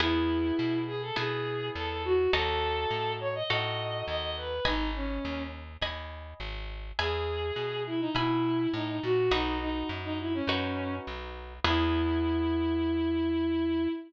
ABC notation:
X:1
M:4/4
L:1/16
Q:1/4=103
K:E
V:1 name="Violin"
E6 G A G4 A A F2 | A6 c d d4 d d B2 | D2 C4 z10 | G6 E D E4 D D F2 |
D2 D2 z D E C5 z4 | E16 |]
V:2 name="Orchestral Harp"
[B,EG]8 [B,EG]8 | [DFA]8 [DFA]8 | [dgb]8 [dgb]8 | [egb]8 [egb]8 |
[DFB]8 [DFB]8 | [B,EG]16 |]
V:3 name="Electric Bass (finger)" clef=bass
E,,4 B,,4 B,,4 E,,4 | D,,4 A,,4 A,,4 D,,4 | G,,,4 D,,4 D,,4 G,,,4 | E,,4 B,,4 B,,4 A,,2 ^A,,2 |
B,,,4 F,,4 F,,4 B,,,4 | E,,16 |]